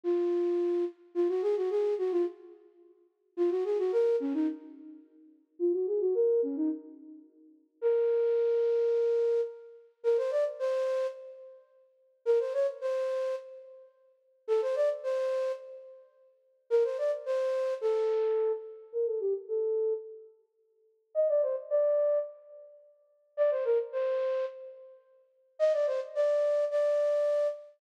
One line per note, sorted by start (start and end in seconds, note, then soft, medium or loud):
0.03 0.85 F4 medium
1.15 1.28 F4 medium
1.29 1.42 F#4 medium
1.42 1.55 G#4 medium
1.56 1.70 F#4 medium
1.70 1.94 G#4 medium
1.98 2.11 F#4 medium
2.11 2.25 F4 medium
3.37 3.50 F4 medium
3.50 3.64 F#4 medium
3.65 3.78 G#4 medium
3.78 3.92 F#4 medium
3.92 4.16 A#4 medium
4.20 4.33 C#4 medium
4.34 4.47 D#4 medium
5.59 5.72 F4 loud
5.73 5.86 F#4 medium
5.87 6.00 G#4 medium
6.01 6.14 F#4 medium
6.14 6.41 A#4 medium
6.43 6.56 C#4 medium
6.56 6.69 D#4 medium
7.81 9.41 A#4 medium
10.03 10.17 A#4 medium
10.17 10.31 C5 medium
10.31 10.44 D5 medium
10.59 11.07 C5 medium
12.25 12.39 A#4 loud
12.40 12.53 C5 medium
12.53 12.67 C#5 medium
12.81 13.35 C5 medium
14.48 14.61 A4 loud
14.62 14.75 C5 medium
14.76 14.89 D5 medium
15.03 15.52 C5 medium
16.70 16.83 A#4 loud
16.84 16.97 C5 medium
16.98 17.11 D5 medium
17.26 17.74 C5 medium
17.81 18.52 A4 medium
18.92 19.06 A#4 loud
19.06 19.20 A4 medium
19.20 19.33 G4 medium
19.48 19.93 A4 medium
21.15 21.28 D#5 medium
21.29 21.42 D5 medium
21.42 21.56 C5 medium
21.70 22.18 D5 medium
23.37 23.50 D5 medium
23.51 23.64 C5 medium
23.65 23.78 A#4 medium
23.92 24.45 C5 medium
25.59 25.72 D#5 loud
25.73 25.86 D5 medium
25.87 26.00 C5 medium
26.15 26.65 D5 medium
26.71 27.48 D5 medium